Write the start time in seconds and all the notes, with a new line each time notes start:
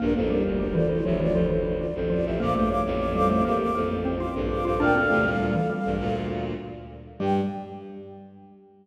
0.00 A#1 G2 A#3 D4 A#4
0.15 A1 F2 A#3 D4 A4 A#4 C5
0.29 G3 D4 G4 A#4
0.45 F1 D2
0.60 G3 D4 A#4
0.74 E3 F4 A4 C5 D5
0.90 E4 C5
1.03 F1 D2 F3 G4 C#5 E5
1.20 E3 F4 D5
1.33 F1 D2 F3 A4 C5
1.50 E3 A4 C5
1.80 F4 D5
1.95 A1 F2 A4 C5
2.10 F3 F4 D5
2.25 A1 F2 G4 A4 C5 E5
2.40 D2 A#2 A#3 F5 D6
2.55 A#1 G2 A3 A4 C5 F5 D6
2.68 C#5 F5 D6
2.86 A1 F2
3.00 F5 D6
3.14 G3 A4 C5 F5 D6
3.29 A3 F5 D6
3.45 A1 F2 A#3 G4 A#4 F5 D6
3.59 F5 D6
3.75 A1 F2 A#3 A4 C5
3.89 A4 C5
4.05 C4
4.20 F4 F5 D6
4.35 A#1 G2 A4 C5
4.50 F5 D6
4.64 A#1 G2 F4 A4 C5 F5 D6
4.79 D2 A#2 D4 A#4 D5 F5 G5
4.95 C4 A4 F5
5.10 E2 C3 A3
5.25 D2 A#2 G3
5.40 D2 A#2 G3
5.55 E3
5.70 G3
5.85 A#1 G2
6.00 D2 A#2
7.19 G2 G3 G4 G5